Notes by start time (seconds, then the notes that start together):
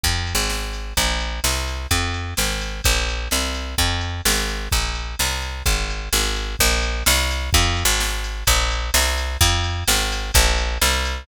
0.04 F2, kick, ride
0.27 ride
0.35 G#1
0.50 snare
0.73 ride
0.97 A#1, kick, ride
1.20 ride
1.44 C2, snare
1.68 ride
1.91 F2, kick, ride
2.14 ride
2.37 G#1, snare
2.61 ride
2.84 A#1, kick, ride
3.09 ride
3.31 C2, snare
3.55 ride
3.78 F2, kick, ride
4.01 ride
4.25 G#1, snare
4.49 ride
4.72 A#1, kick, ride
4.95 ride
5.19 C2, snare
5.42 ride
5.66 G#1, kick, ride
5.90 ride
6.13 G#1, snare
6.36 ride
6.59 A#1, kick, crash
6.82 ride
7.06 C2, snare
7.31 ride
7.53 F2, kick, ride
7.77 ride
7.85 G#1
8.00 snare
8.24 ride
8.47 A#1, kick, ride
8.71 ride
8.94 C2, snare
9.18 ride
9.41 F2, kick, ride
9.64 ride
9.88 G#1, snare
10.12 ride
10.34 A#1, kick, ride
10.58 ride
10.82 C2, snare
11.05 ride